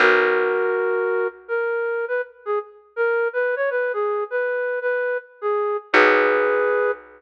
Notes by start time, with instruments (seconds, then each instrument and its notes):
0.00 electric bass (finger) B1, flute F#4 A#4
1.48 flute A#4
2.08 flute B4
2.46 flute G#4
2.96 flute A#4
3.33 flute B4
3.56 flute C#5
3.71 flute B4
3.93 flute G#4
4.31 flute B4
4.81 flute B4
5.42 flute G#4
5.93 electric bass (finger) B1, flute G#4 B4